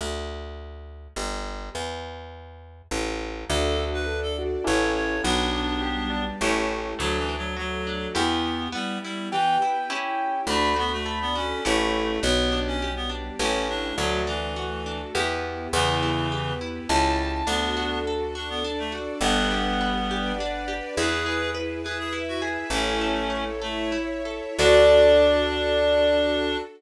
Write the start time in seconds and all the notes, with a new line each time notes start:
0.01 D2
1.16 G1
1.75 E2
2.91 A1
3.48 D2 D4 F#4 A4
3.79 F#4
3.94 B4
4.06 D4 A4 D5
4.23 A4
4.39 F#4
4.64 A1 C#4 E4 G4 A4 C#5
4.95 C#5
5.24 B1 B3 D4 G4
5.54 D4
5.81 G3 B3 G4
6.10 D4
6.40 A1 A3 C#4 E4 G4
6.99 D2 F#3 A3 D4 F#4
7.18 E3
7.29 D4
7.38 F#3
7.57 F#3 A3 F#4 A4
7.87 D4
8.15 E2 B3 E4 G4
8.72 G3 B3 E4 G4
9.03 G3 E4
9.31 E3 B3 G4 B4 G5
9.62 E4
9.90 C#4 E4 G4
10.47 D2 A3 D4 F#4 A4 B5
10.76 B3 F#4
10.93 A3
11.06 D4 A4 D5
11.21 B3
11.35 C#4 F#4
11.65 A1 A3 C#4 E4 G4 A4
12.22 B1 B3 D4 G4
12.52 D4
12.67 C#4
12.81 G3 B3 G4
12.96 B3
13.09 D4
13.39 A1 A3 C#4 E4 G4
13.69 D4
13.98 D2 F#3 A3 D4 F#4
14.27 E3 D4
14.56 A3 F#4 A4
14.86 D4
15.14 E2 B3 E4 G4
15.72 E2 C#3 E3 B3 E4 G4
16.03 E4
16.29 B3 G4 B4
16.61 E4
16.88 C#2 C#4 E4 G4 A5
17.47 D2 B3 D4 F#4 A4
17.77 F#4
18.07 A4
18.35 D4 F#4 A4 D5
18.49 B3
18.64 D4
18.79 A3
18.92 F#4
19.21 G1 G3 B3 D4 G4 B4 F#5
19.51 G4
19.81 B4
20.08 D4 G4 B4 D5
20.40 D4
20.68 G4
20.97 E2 E4 G#4 B4
21.26 G#4
21.54 B4
21.83 E4 G#4 B4 E5
21.99 G#4
22.13 E4
22.28 F#4
22.42 G#4
22.70 A1 A3 C#4 E4 A4 C#5
23.01 A4
23.30 C#5
23.62 A3 E4 A4 C#5 E5
23.92 E4
24.25 A4
24.59 D2 D4 F#4 A4 D5